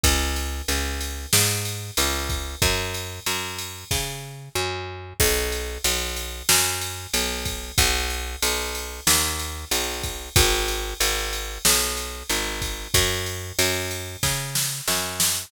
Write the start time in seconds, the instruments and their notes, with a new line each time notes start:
0.03 electric bass (finger) C#2, kick, ride
0.36 ride
0.68 electric bass (finger) C#2, ride
1.01 ride
1.33 electric bass (finger) G#2, snare
1.65 ride
1.97 electric bass (finger) C#2, ride
2.30 kick, ride
2.62 electric bass (finger) F#2, kick, ride
2.94 ride
3.26 electric bass (finger) F#2, ride
3.58 ride
3.91 electric bass (finger) C#3, kick, snare
4.55 electric bass (finger) F#2
5.20 electric bass (finger) B1, kick, crash
5.52 ride
5.84 electric bass (finger) B1, ride
6.17 ride
6.49 electric bass (finger) F#2, snare
6.81 ride
7.14 electric bass (finger) B1, ride
7.45 kick, ride
7.78 electric bass (finger) B1, kick, ride
8.10 ride
8.42 electric bass (finger) B1, ride
8.75 ride
9.07 electric bass (finger) D#2, snare
9.39 ride
9.71 electric bass (finger) B1, ride
10.03 kick, ride
10.36 electric bass (finger) G#1, kick, ride
10.68 ride
11.00 electric bass (finger) G#1, ride
11.33 ride
11.65 electric bass (finger) B1, snare
11.97 ride
12.30 electric bass (finger) G#1, ride
12.62 kick, ride
12.94 electric bass (finger) F#2, kick, ride
13.26 ride
13.59 electric bass (finger) F#2, ride
13.91 ride
14.23 electric bass (finger) C#3, kick, snare
14.55 snare
14.88 electric bass (finger) F#2, snare
15.20 snare